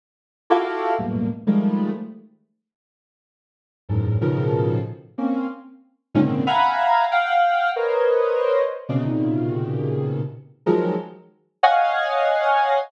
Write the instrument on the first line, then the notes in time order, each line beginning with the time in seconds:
ocarina
0.50 E4 F4 F#4 G4 A4
0.98 E2 F#2 G2 A2 A#2 B2
1.47 D#3 F3 G3 G#3 A3
3.89 E2 F#2 G#2 A2
4.21 A2 B2 C#3 D#3 F3
5.18 A#3 C4 C#4
6.15 G#2 A#2 C3 C#3 D3 D#3
6.47 E5 F5 F#5 G#5 A#5 B5
7.11 F5 F#5 G5
7.76 A#4 B4 C5 C#5 D#5
8.89 B2 C3 C#3
9.05 A#2 B2 C3 C#3 D#3
10.66 D#3 F3 F#3 G#3
11.63 C#5 D#5 F5 F#5 G#5